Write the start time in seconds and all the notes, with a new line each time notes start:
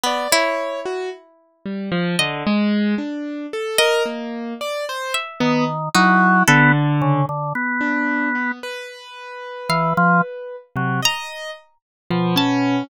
0.04 B3 D5
0.32 E4 C#5
0.85 F#4
1.66 G3
1.92 F3
2.19 D3 D#5
2.46 G#3
2.98 D4
3.53 A4
3.78 A#4 D#5
4.06 A#3
4.61 D5
4.89 C5
5.14 E5
5.40 D#3 B3
5.94 F#3 D#4 E4
6.48 D3 B3 A4
7.02 C#3
7.29 D3
7.55 B3
7.81 D4
8.35 B3
8.63 B4
9.69 E3 F5
9.97 F3
10.75 C3 F#3
11.02 D#5 A#5
12.10 B2 F3
12.36 C#4 A5